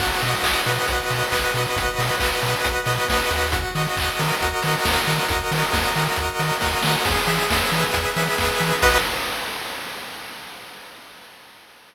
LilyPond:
<<
  \new Staff \with { instrumentName = "Lead 1 (square)" } { \time 4/4 \key b \major \tempo 4 = 136 fis'8 dis''8 fis'8 b'8 fis'8 dis''8 b'8 fis'8 | fis'8 dis''8 fis'8 b'8 fis'8 dis''8 b'8 fis'8 | fis'8 dis''8 fis'8 ais'8 fis'8 dis''8 ais'8 fis'8 | fis'8 dis''8 fis'8 ais'8 fis'8 dis''8 ais'8 fis'8 |
gis'8 e''8 gis'8 b'8 gis'8 e''8 b'8 gis'8 | <fis' b' dis''>4 r2. | }
  \new Staff \with { instrumentName = "Synth Bass 1" } { \clef bass \time 4/4 \key b \major b,,8 b,8 b,,8 b,8 b,,8 b,8 b,,8 b,8 | b,,8 b,8 b,,8 b,8 b,,8 b,8 b,,8 dis,8~ | dis,8 dis8 dis,8 dis8 dis,8 dis8 dis,8 dis8 | dis,8 dis8 dis,8 dis8 dis,8 dis8 dis,8 dis8 |
e,8 e8 e,8 e8 e,8 e8 e,8 e8 | b,,4 r2. | }
  \new DrumStaff \with { instrumentName = "Drums" } \drummode { \time 4/4 <cymc bd>8 hho8 <hc bd>8 hho8 <hh bd>8 hho8 <hc bd>8 hho8 | <hh bd>8 hho8 <hc bd>8 hho8 <hh bd>8 hho8 <bd sn>8 hho8 | <hh bd>8 hho8 <hc bd>8 hho8 <hh bd>8 hho8 <bd sn>8 hho8 | <hh bd>8 hho8 <bd sn>8 hho8 <hh bd>8 hho8 <bd sn>8 sn8 |
<cymc bd>8 hho8 <bd sn>8 hho8 <hh bd>8 hho8 <bd sn>8 hho8 | <cymc bd>4 r4 r4 r4 | }
>>